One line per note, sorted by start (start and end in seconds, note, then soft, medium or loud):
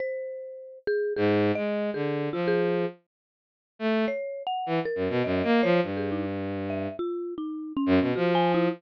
0.00 0.79 C5 medium
0.87 1.13 G#4 loud
1.17 1.52 G#2 loud
1.17 1.51 G#4 medium
1.55 1.90 G#3 medium
1.55 1.90 D#5 medium
1.94 2.29 D3 medium
1.94 2.29 G#4 medium
2.33 2.85 F3 medium
2.33 2.46 F4 medium
2.48 2.87 G#4 loud
3.79 4.05 A3 medium
4.08 4.43 C#5 medium
4.47 4.82 F#5 medium
4.66 4.79 E3 medium
4.85 5.20 A#4 medium
4.95 5.08 F#2 medium
5.09 5.22 B2 medium
5.24 5.42 F#2 medium
5.24 5.42 D#5 medium
5.44 5.61 A#3 loud
5.44 5.61 D#5 medium
5.63 5.80 F3 loud
5.63 5.80 C#5 loud
5.83 6.88 G2 medium
5.97 6.10 G#4 medium
6.12 6.25 D#4 medium
6.70 6.96 E5 medium
6.99 7.34 F4 medium
7.38 7.73 D#4 medium
7.77 8.12 C#4 loud
7.86 7.99 F#2 loud
8.00 8.13 B2 medium
8.16 8.68 F3 medium
8.16 8.33 F#4 medium
8.35 8.52 G#5 loud
8.54 8.72 E4 medium